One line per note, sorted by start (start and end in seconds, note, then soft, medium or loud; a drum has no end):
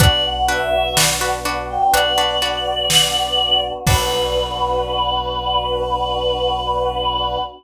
0.00 1.78 B1 loud
0.00 3.83 B3 medium
0.00 0.39 D4 loud
0.00 3.83 D4 medium
0.00 0.39 F#4 loud
0.00 3.83 F#4 medium
0.00 0.39 B4 loud
0.00 0.23 D5 loud
0.00 kick loud
0.00 closed hi-hat loud
0.25 0.48 F#5 medium
0.48 0.87 D4 medium
0.48 0.87 F#4 medium
0.48 0.87 B4 medium
0.48 0.95 E5 medium
0.97 1.16 D4 medium
0.97 1.16 F#4 medium
0.97 1.16 B4 medium
0.97 snare loud
1.21 1.40 D4 medium
1.21 1.40 F#4 medium
1.21 1.40 B4 medium
1.45 1.84 D4 loud
1.45 1.84 F#4 medium
1.45 1.84 B4 medium
1.69 1.92 G5 medium
1.93 3.71 B1 medium
1.93 2.13 D4 medium
1.93 2.13 F#4 medium
1.93 2.13 B4 medium
1.93 3.60 D5 loud
1.93 closed hi-hat loud
2.18 2.37 D4 medium
2.18 2.37 F#4 medium
2.18 2.37 B4 medium
2.42 3.19 D4 medium
2.42 3.19 F#4 medium
2.42 3.19 B4 medium
2.90 snare loud
3.86 7.38 B1 loud
3.86 7.38 B3 loud
3.86 7.38 D4 loud
3.86 7.38 D4 medium
3.86 7.38 F#4 loud
3.86 7.38 F#4 medium
3.86 7.38 B4 loud
3.86 kick loud
3.86 crash loud